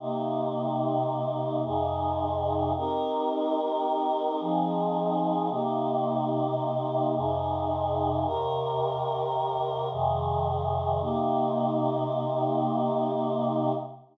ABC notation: X:1
M:5/4
L:1/8
Q:1/4=109
K:Cm
V:1 name="Choir Aahs"
[C,B,EG]6 [F,,C,EA]4 | [CEGB]6 [F,CEA]4 | [C,B,EG]6 [F,,C,EA]4 | [E,,C,GB]6 [F,,C,E,A]4 |
[C,B,EG]10 |]